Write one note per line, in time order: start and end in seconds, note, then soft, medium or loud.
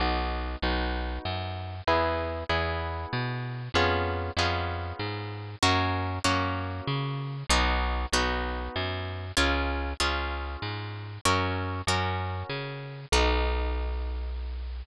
0.00 0.56 B1 medium
0.00 0.57 B3 loud
0.00 0.57 D#4 loud
0.00 0.57 F#4 loud
0.62 1.19 B1 medium
0.62 1.76 B3 medium
0.62 1.76 D#4 loud
0.62 1.76 F#4 loud
1.25 1.81 F#2 medium
1.87 2.44 E2 medium
1.87 2.44 B3 loud
1.87 2.44 E4 loud
1.87 2.44 G#4 loud
2.49 3.06 E2 medium
2.49 3.62 B3 loud
2.49 3.62 E4 medium
2.49 3.62 G#4 loud
3.13 3.69 B2 medium
3.74 4.30 F2 medium
3.74 4.32 B3 loud
3.74 4.32 C#4 loud
3.74 4.32 F4 loud
3.74 4.32 G#4 loud
4.37 4.93 F2 medium
4.37 5.51 B3 loud
4.37 5.51 C#4 medium
4.37 5.51 F4 loud
4.37 5.51 G#4 loud
4.99 5.56 G#2 medium
5.62 6.19 F#2 medium
5.62 6.19 A#3 loud
5.62 6.19 C#4 loud
5.62 6.19 F#4 loud
6.24 6.81 F#2 medium
6.24 7.37 A#3 medium
6.24 7.37 C#4 loud
6.24 7.37 F#4 loud
6.87 7.44 C#3 medium
7.49 8.06 B1 loud
7.49 8.07 B3 loud
7.49 8.07 D#4 loud
7.49 8.07 F#4 loud
8.12 8.69 B1 medium
8.12 9.26 B3 loud
8.12 9.26 D#4 medium
8.12 9.26 F#4 loud
8.76 9.32 F#2 medium
9.37 9.94 C#2 medium
9.37 9.93 C#4 loud
9.37 9.93 F4 loud
9.37 9.93 G#4 loud
10.00 10.57 C#2 medium
10.00 11.12 C#4 loud
10.00 11.12 F4 loud
10.00 11.12 G#4 medium
10.62 11.18 G#2 medium
11.25 11.82 F#2 medium
11.25 11.82 C#4 loud
11.25 11.82 F#4 loud
11.25 11.82 A#4 loud
11.87 12.43 F#2 medium
11.87 13.01 C#4 loud
11.87 13.01 F#4 loud
11.87 13.01 A#4 loud
12.49 13.06 C#3 medium
13.12 14.83 B1 loud
13.12 14.84 B3 medium
13.12 14.84 D#4 loud
13.12 14.84 F#4 medium